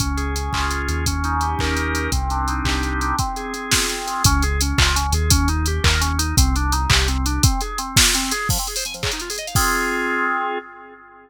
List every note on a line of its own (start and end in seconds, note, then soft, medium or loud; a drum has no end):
0.00 0.49 C#2 medium
0.00 0.35 C#4 medium
0.00 kick medium
0.00 closed hi-hat medium
0.17 0.88 G#4 medium
0.17 closed hi-hat medium
0.35 0.70 C#4 medium
0.35 closed hi-hat medium
0.53 0.87 C#2 medium
0.53 1.04 F4 medium
0.53 kick medium
0.53 clap loud
0.71 1.04 C#4 medium
0.71 closed hi-hat medium
0.88 1.55 D#2 medium
0.88 1.05 G#4 medium
0.88 closed hi-hat medium
1.06 1.76 C#4 loud
1.06 kick medium
1.06 closed hi-hat loud
1.24 1.94 D#4 medium
1.24 closed hi-hat medium
1.41 2.09 G4 medium
1.41 closed hi-hat medium
1.59 2.08 D#2 medium
1.59 2.10 A#4 medium
1.59 kick medium
1.59 clap medium
1.77 2.10 C#4 medium
1.77 closed hi-hat medium
1.95 2.12 D#4 medium
1.95 closed hi-hat medium
2.12 2.61 C2 medium
2.12 2.82 C4 medium
2.12 kick medium
2.12 closed hi-hat medium
2.30 3.01 D4 medium
2.30 closed hi-hat medium
2.48 3.15 D#4 medium
2.48 closed hi-hat medium
2.64 3.13 C2 medium
2.64 3.15 G4 medium
2.64 kick medium
2.64 clap loud
2.82 3.16 C4 medium
2.82 closed hi-hat medium
3.01 3.18 D4 medium
3.01 closed hi-hat medium
3.19 3.53 C4 medium
3.19 kick medium
3.19 closed hi-hat medium
3.36 4.06 G#4 medium
3.36 closed hi-hat medium
3.54 3.88 C4 medium
3.54 closed hi-hat medium
3.71 4.22 F4 medium
3.71 kick medium
3.71 snare loud
3.89 4.22 C4 medium
3.89 closed hi-hat medium
4.07 4.23 G#4 medium
4.07 closed hi-hat medium
4.24 4.73 C#2 medium
4.24 4.43 C#4 loud
4.24 kick loud
4.24 closed hi-hat loud
4.42 4.60 G#4 medium
4.42 closed hi-hat medium
4.61 4.79 C#4 medium
4.61 closed hi-hat loud
4.78 5.12 C#2 medium
4.78 4.95 F4 medium
4.78 kick loud
4.78 clap loud
4.95 5.13 C#4 medium
4.95 closed hi-hat loud
5.12 5.79 D#2 medium
5.12 5.31 G#4 medium
5.12 closed hi-hat loud
5.30 5.49 C#4 loud
5.30 kick loud
5.30 closed hi-hat loud
5.48 5.66 D#4 medium
5.48 closed hi-hat medium
5.66 5.85 G4 medium
5.66 closed hi-hat medium
5.84 6.33 D#2 medium
5.84 6.01 A#4 loud
5.84 kick loud
5.84 clap loud
6.01 6.19 C#4 medium
6.01 closed hi-hat loud
6.18 6.35 D#4 medium
6.18 closed hi-hat loud
6.37 6.86 C2 medium
6.37 6.55 C4 loud
6.37 kick loud
6.37 closed hi-hat loud
6.55 6.73 D4 medium
6.55 closed hi-hat medium
6.72 6.90 D#4 medium
6.72 closed hi-hat medium
6.89 7.39 C2 medium
6.89 7.07 G4 medium
6.89 kick loud
6.89 clap loud
7.07 7.25 C4 medium
7.07 closed hi-hat medium
7.25 7.42 D4 medium
7.25 closed hi-hat medium
7.43 7.61 C4 loud
7.43 kick loud
7.43 closed hi-hat loud
7.61 7.79 G#4 medium
7.61 closed hi-hat medium
7.78 7.96 C4 medium
7.78 closed hi-hat medium
7.97 8.15 F4 medium
7.97 kick loud
7.97 snare loud
8.15 8.32 C4 loud
8.15 closed hi-hat medium
8.31 8.48 G#4 medium
8.31 closed hi-hat loud
8.49 8.58 F3 medium
8.49 kick loud
8.49 crash loud
8.58 8.67 C4 medium
8.58 closed hi-hat medium
8.67 8.76 G#4 medium
8.67 closed hi-hat medium
8.76 8.84 C5 medium
8.76 open hi-hat medium
8.85 8.94 G#5 medium
8.85 closed hi-hat medium
8.94 9.02 F3 medium
8.94 closed hi-hat medium
9.03 9.11 C#3 medium
9.03 kick medium
9.03 clap loud
9.12 9.21 D#4 medium
9.12 closed hi-hat medium
9.20 9.29 F4 medium
9.20 closed hi-hat medium
9.30 9.38 G#4 medium
9.30 open hi-hat medium
9.38 9.46 D#5 medium
9.38 closed hi-hat medium
9.47 9.55 F5 medium
9.47 closed hi-hat medium
9.55 10.58 C4 medium
9.55 10.58 F4 medium
9.55 10.58 G#4 loud
9.55 kick loud
9.55 crash loud